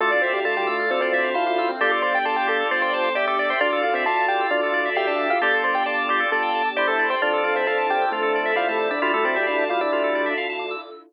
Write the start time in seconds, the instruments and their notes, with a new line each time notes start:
0.00 drawbar organ D2 F4 A4 D5, acoustic grand piano A3 A4, pad 2 (warm) D4 E4 F4 A4
0.11 acoustic grand piano D4 D5, drawbar organ D5
0.22 acoustic grand piano C4 C5, drawbar organ E5
0.33 acoustic grand piano G3 G4, drawbar organ F5
0.45 acoustic grand piano A3 A4, drawbar organ F4 D5 A5
0.55 acoustic grand piano G3 G4, drawbar organ D6
0.67 acoustic grand piano A3 A4, drawbar organ E6
0.79 drawbar organ F6
0.90 drawbar organ D2 A4, acoustic grand piano C4 C5
1.01 acoustic grand piano C4 C5, drawbar organ D5
1.13 acoustic grand piano C4 C5, drawbar organ E5
1.24 drawbar organ F5
1.34 drawbar organ E4 C5 A5, acoustic grand piano F4 F5
1.46 acoustic grand piano F4 F5, drawbar organ D6
1.58 acoustic grand piano F4 F5, drawbar organ E6
1.69 acoustic grand piano C4 C5, drawbar organ F6
1.80 drawbar organ G1 F4 G4 D5, pad 2 (warm) D4 G4 A4, acoustic grand piano A4 A5
1.91 drawbar organ A4, acoustic grand piano D5 D6
2.02 acoustic grand piano C5 C6, drawbar organ D5
2.14 acoustic grand piano G4 G5, drawbar organ G5
2.25 drawbar organ F4 D5 A5, acoustic grand piano A4 A5
2.36 acoustic grand piano G4 G5, drawbar organ D6
2.47 drawbar organ G4, acoustic grand piano A4 A5
2.60 drawbar organ A4
2.71 drawbar organ G1 D5, acoustic grand piano C5 C6
2.82 acoustic grand piano C5 C6, drawbar organ G5
2.93 acoustic grand piano C5 C6, drawbar organ A5
3.04 drawbar organ D6
3.15 drawbar organ G4 E5, acoustic grand piano D5 D6
3.27 drawbar organ A4, acoustic grand piano D5 D6
3.39 drawbar organ D5, acoustic grand piano D5 D6
3.49 acoustic grand piano C5 C6, drawbar organ G5
3.61 drawbar organ D2 F4 D5, acoustic grand piano D4 D5, pad 2 (warm) D4 E4 F4 A4
3.72 drawbar organ A4
3.83 acoustic grand piano F4 F5, drawbar organ D5
3.94 acoustic grand piano C4 C5, drawbar organ E5
4.06 drawbar organ F4 D5 F5, acoustic grand piano A4 A5
4.17 drawbar organ A5
4.28 acoustic grand piano G4 G5, drawbar organ D6
4.41 drawbar organ E6
4.50 drawbar organ D2 F4, acoustic grand piano D4 D5
4.63 drawbar organ A4
4.74 drawbar organ D5
4.85 drawbar organ E5
4.95 acoustic grand piano G4 G5, drawbar organ G4 E5 F5
5.07 acoustic grand piano D4 D5, drawbar organ A5
5.19 drawbar organ D6
5.30 acoustic grand piano F4 F5, drawbar organ E6
5.41 drawbar organ G1 F4 G4 D5, pad 2 (warm) D4 G4 A4, acoustic grand piano A4 A5
5.53 drawbar organ A4
5.64 acoustic grand piano C5 C6, drawbar organ D5
5.75 acoustic grand piano G4 G5, drawbar organ G5
5.86 drawbar organ F4 D5 A5, acoustic grand piano D5 D6
5.98 drawbar organ D6
6.09 drawbar organ G4, acoustic grand piano D5 D6
6.20 drawbar organ A4
6.32 drawbar organ G1 D5, acoustic grand piano A4 A5
6.42 drawbar organ G5
6.55 drawbar organ A5
6.65 drawbar organ D6
6.76 drawbar organ E4 G4 C5, acoustic grand piano D5 D6
6.87 drawbar organ A4, acoustic grand piano A4 A5
6.99 drawbar organ D5
7.10 acoustic grand piano C5 C6, drawbar organ G5
7.20 drawbar organ F2 F3 D4 F4, pad 2 (warm) D4 E4 F4 A4, acoustic grand piano D4 D5
7.33 drawbar organ A4
7.44 acoustic grand piano F4 F5, drawbar organ D5
7.56 acoustic grand piano C4 C5, drawbar organ E5
7.67 drawbar organ F3 D4 F5, acoustic grand piano A4 A5
7.78 drawbar organ A5
7.89 acoustic grand piano G4 G5, drawbar organ D6
8.02 drawbar organ E6
8.12 drawbar organ F2 F4, acoustic grand piano A3 A4
8.22 drawbar organ A4
8.35 drawbar organ D5
8.45 drawbar organ E5
8.56 drawbar organ G3 E4 F5, acoustic grand piano F4 F5
8.68 acoustic grand piano A3 A4, drawbar organ A5
8.79 drawbar organ D6
8.91 acoustic grand piano D4 D5, drawbar organ E6
9.02 drawbar organ D2 G3 E4 F4, pad 2 (warm) D4 E4 F4 A4, acoustic grand piano D4 D5
9.14 acoustic grand piano A3 A4, drawbar organ A4
9.25 acoustic grand piano C4 C5, drawbar organ D5
9.36 acoustic grand piano G3 G4, drawbar organ E5
9.47 acoustic grand piano D4 D5, drawbar organ F5
9.58 drawbar organ A5
9.69 drawbar organ G3 E4 D6, acoustic grand piano F4 F5
9.81 acoustic grand piano D4 D5, drawbar organ E6
9.92 drawbar organ D2 F4
10.04 drawbar organ A4
10.15 drawbar organ D5
10.26 drawbar organ E5
10.37 drawbar organ F5
10.49 drawbar organ A5
10.59 drawbar organ D6
10.71 drawbar organ E6